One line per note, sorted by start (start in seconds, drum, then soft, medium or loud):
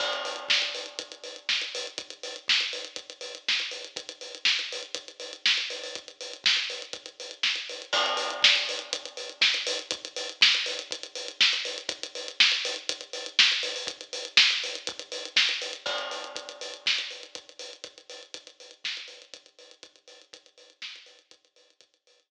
0.00 kick medium
0.00 crash medium
0.13 closed hi-hat medium
0.25 open hi-hat medium
0.36 closed hi-hat medium
0.49 kick medium
0.49 snare loud
0.62 closed hi-hat medium
0.75 open hi-hat medium
0.86 closed hi-hat medium
0.99 kick medium
0.99 closed hi-hat loud
1.12 closed hi-hat medium
1.24 open hi-hat medium
1.36 closed hi-hat medium
1.49 kick medium
1.49 snare medium
1.61 closed hi-hat medium
1.75 open hi-hat medium
1.87 closed hi-hat medium
1.98 kick medium
1.98 closed hi-hat medium
2.10 closed hi-hat medium
2.23 open hi-hat medium
2.36 closed hi-hat medium
2.48 kick medium
2.48 snare loud
2.60 closed hi-hat medium
2.73 open hi-hat medium
2.85 closed hi-hat medium
2.96 kick medium
2.96 closed hi-hat medium
3.10 closed hi-hat medium
3.21 open hi-hat medium
3.35 closed hi-hat medium
3.48 kick medium
3.48 snare medium
3.60 closed hi-hat medium
3.71 open hi-hat medium
3.85 closed hi-hat medium
3.96 kick medium
3.96 closed hi-hat medium
4.09 closed hi-hat medium
4.21 open hi-hat medium
4.35 closed hi-hat medium
4.45 kick medium
4.45 snare loud
4.59 closed hi-hat medium
4.72 open hi-hat medium
4.83 closed hi-hat medium
4.95 kick medium
4.95 closed hi-hat loud
5.08 closed hi-hat medium
5.20 open hi-hat medium
5.33 closed hi-hat medium
5.46 kick medium
5.46 snare loud
5.58 closed hi-hat medium
5.70 open hi-hat medium
5.84 open hi-hat medium
5.95 kick medium
5.95 closed hi-hat medium
6.08 closed hi-hat medium
6.21 open hi-hat medium
6.33 closed hi-hat medium
6.44 kick medium
6.44 snare loud
6.57 closed hi-hat medium
6.70 open hi-hat medium
6.82 closed hi-hat medium
6.93 kick medium
6.93 closed hi-hat medium
7.06 closed hi-hat medium
7.20 open hi-hat medium
7.31 closed hi-hat medium
7.43 kick medium
7.43 snare medium
7.56 closed hi-hat medium
7.69 open hi-hat medium
7.82 closed hi-hat medium
7.93 kick loud
7.93 crash loud
8.06 closed hi-hat medium
8.17 open hi-hat medium
8.30 closed hi-hat medium
8.42 kick medium
8.42 snare loud
8.55 closed hi-hat medium
8.69 open hi-hat medium
8.79 closed hi-hat medium
8.93 kick medium
8.93 closed hi-hat loud
9.05 closed hi-hat medium
9.17 open hi-hat medium
9.29 closed hi-hat medium
9.41 kick loud
9.41 snare loud
9.54 closed hi-hat medium
9.67 open hi-hat loud
9.79 closed hi-hat medium
9.91 kick loud
9.91 closed hi-hat loud
10.05 closed hi-hat medium
10.16 open hi-hat medium
10.29 closed hi-hat medium
10.41 kick medium
10.41 snare loud
10.55 closed hi-hat medium
10.66 open hi-hat medium
10.79 closed hi-hat medium
10.91 kick medium
10.91 closed hi-hat loud
11.03 closed hi-hat medium
11.15 open hi-hat medium
11.28 closed hi-hat medium
11.41 kick loud
11.41 snare loud
11.53 closed hi-hat medium
11.65 open hi-hat medium
11.78 closed hi-hat medium
11.89 kick loud
11.89 closed hi-hat loud
12.03 closed hi-hat medium
12.15 open hi-hat medium
12.28 closed hi-hat medium
12.40 kick medium
12.40 snare loud
12.52 closed hi-hat medium
12.65 open hi-hat medium
12.76 closed hi-hat medium
12.89 kick medium
12.89 closed hi-hat loud
13.01 closed hi-hat medium
13.13 open hi-hat medium
13.26 closed hi-hat medium
13.39 kick loud
13.39 snare loud
13.52 closed hi-hat medium
13.63 open hi-hat medium
13.76 open hi-hat medium
13.87 kick loud
13.87 closed hi-hat loud
14.01 closed hi-hat medium
14.13 open hi-hat medium
14.25 closed hi-hat medium
14.37 kick loud
14.37 snare loud
14.50 closed hi-hat medium
14.64 open hi-hat medium
14.75 closed hi-hat medium
14.87 kick loud
14.87 closed hi-hat loud
14.99 closed hi-hat medium
15.12 open hi-hat medium
15.25 closed hi-hat medium
15.36 kick loud
15.36 snare loud
15.49 closed hi-hat medium
15.62 open hi-hat medium
15.73 closed hi-hat medium
15.86 kick loud
15.86 crash medium
15.98 closed hi-hat medium
16.11 open hi-hat medium
16.24 closed hi-hat medium
16.36 kick medium
16.36 closed hi-hat medium
16.49 closed hi-hat medium
16.61 open hi-hat medium
16.74 closed hi-hat medium
16.86 kick medium
16.86 snare loud
16.98 closed hi-hat medium
17.11 open hi-hat medium
17.23 closed hi-hat medium
17.35 kick medium
17.35 closed hi-hat medium
17.49 closed hi-hat medium
17.59 open hi-hat medium
17.73 closed hi-hat medium
17.84 kick medium
17.84 closed hi-hat medium
17.98 closed hi-hat medium
18.10 open hi-hat medium
18.23 closed hi-hat medium
18.34 kick medium
18.34 closed hi-hat loud
18.47 closed hi-hat medium
18.60 open hi-hat medium
18.71 closed hi-hat medium
18.84 kick medium
18.84 snare loud
18.97 closed hi-hat medium
19.08 open hi-hat medium
19.22 closed hi-hat medium
19.34 kick medium
19.34 closed hi-hat loud
19.46 closed hi-hat medium
19.59 open hi-hat medium
19.71 closed hi-hat medium
19.83 kick medium
19.83 closed hi-hat medium
19.96 closed hi-hat medium
20.08 open hi-hat medium
20.21 closed hi-hat medium
20.33 kick medium
20.33 closed hi-hat loud
20.46 closed hi-hat medium
20.58 open hi-hat medium
20.70 closed hi-hat medium
20.82 kick medium
20.82 snare loud
20.96 closed hi-hat medium
21.06 open hi-hat medium
21.19 closed hi-hat medium
21.31 kick medium
21.31 closed hi-hat loud
21.45 closed hi-hat medium
21.56 open hi-hat medium
21.70 closed hi-hat medium
21.81 kick medium
21.81 closed hi-hat loud
21.94 closed hi-hat medium
22.07 open hi-hat medium
22.20 closed hi-hat medium